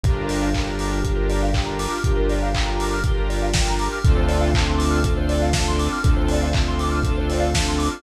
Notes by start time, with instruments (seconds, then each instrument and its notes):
0.04 synth bass 1 G1, lead 2 (sawtooth) D4 F4 G4 A#4, electric piano 2 G4, kick, closed hi-hat
0.15 electric piano 2 A#4
0.29 electric piano 2 D5, open hi-hat
0.42 electric piano 2 F5
0.54 lead 2 (sawtooth) D4 F4 G4 A#4, electric piano 2 G5, kick, clap
0.67 electric piano 2 A#5
0.79 electric piano 2 D6, open hi-hat
0.93 electric piano 2 F6
1.02 lead 2 (sawtooth) D4 F4 G4 A#4, electric piano 2 G4, kick, closed hi-hat
1.16 electric piano 2 A#4
1.29 electric piano 2 D5, open hi-hat
1.42 electric piano 2 F5
1.53 lead 2 (sawtooth) D4 F4 G4 A#4, electric piano 2 G5, kick, clap
1.66 electric piano 2 A#5
1.79 electric piano 2 D6, open hi-hat
1.91 electric piano 2 F6
2.04 synth bass 1 G1, lead 2 (sawtooth) D4 F4 G4 A#4, electric piano 2 G4, kick, closed hi-hat
2.17 electric piano 2 A#4
2.29 electric piano 2 D5, open hi-hat
2.42 electric piano 2 F5
2.54 lead 2 (sawtooth) D4 F4 G4 A#4, electric piano 2 G5, kick, clap
2.66 electric piano 2 A#5
2.80 electric piano 2 D6, open hi-hat
2.94 electric piano 2 F6
3.04 lead 2 (sawtooth) D4 F4 G4 A#4, electric piano 2 G4, kick, closed hi-hat
3.17 electric piano 2 A#4
3.29 electric piano 2 D5, open hi-hat
3.42 electric piano 2 F5
3.53 lead 2 (sawtooth) D4 F4 G4 A#4, electric piano 2 G5, kick, snare
3.68 electric piano 2 A#5
3.79 electric piano 2 D6, open hi-hat
3.92 electric piano 2 F6
4.04 synth bass 1 D2, lead 2 (sawtooth) C4 D4 F4 A4, electric piano 2 A4, kick, closed hi-hat
4.17 electric piano 2 C5
4.28 electric piano 2 D5, open hi-hat
4.41 electric piano 2 F5
4.54 lead 2 (sawtooth) C4 D4 F4 A4, electric piano 2 A5, kick, clap
4.67 electric piano 2 C6
4.78 electric piano 2 D6, open hi-hat
4.91 electric piano 2 F6
5.03 lead 2 (sawtooth) C4 D4 F4 A4, electric piano 2 A4, kick, closed hi-hat
5.17 electric piano 2 C5
5.29 electric piano 2 D5, open hi-hat
5.42 electric piano 2 F5
5.53 lead 2 (sawtooth) C4 D4 F4 A4, electric piano 2 A5, kick, snare
5.68 electric piano 2 C6
5.79 electric piano 2 D6, open hi-hat
5.92 electric piano 2 F6
6.04 synth bass 1 D2, lead 2 (sawtooth) C4 D4 F4 A4, electric piano 2 A4, kick, closed hi-hat
6.16 electric piano 2 C5
6.28 electric piano 2 D5, open hi-hat
6.42 electric piano 2 F5
6.53 lead 2 (sawtooth) C4 D4 F4 A4, electric piano 2 A5, kick, clap
6.68 electric piano 2 C6
6.79 electric piano 2 D6, open hi-hat
6.91 electric piano 2 F6
7.03 lead 2 (sawtooth) C4 D4 F4 A4, electric piano 2 A4, kick, closed hi-hat
7.17 electric piano 2 C5
7.30 electric piano 2 D5, open hi-hat
7.40 electric piano 2 F5
7.54 lead 2 (sawtooth) C4 D4 F4 A4, electric piano 2 A5, kick, snare
7.68 electric piano 2 C6
7.78 electric piano 2 D6, open hi-hat
7.91 electric piano 2 F6